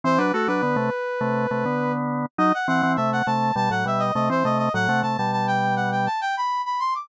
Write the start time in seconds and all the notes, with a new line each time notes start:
0.04 E3 C4 C5
0.18 F#3 D4 B4
0.33 A3 F#4 A4
0.48 F#3 D4 B4
0.63 D3 B3
0.76 C3 A3
1.21 C3 A3
1.51 C3 A3
1.65 D3 B3
2.38 F#3 D#4 D#5
2.54 F#5
2.68 E3 C4 F#5
2.83 E3 C4
2.96 C3 A3 E5
3.13 F#5
3.27 C3 A3 A5
3.56 B2 G3 A5
3.70 A2 F#3 F#5
3.86 B2 G3 E5
3.99 D#5
4.15 C3 A3 D#5
4.30 E3 C4 C5
4.45 C3 A3 D#5
4.58 D#5
4.74 A2 F#3 F#5
4.89 C3 A3
5.03 C3 A3 A5
5.17 B2 G3 A5
5.32 A5
5.47 G5
5.76 F#5
5.92 G5
6.06 A5
6.21 G5
6.37 B5
6.66 B5
6.80 C6
6.95 D6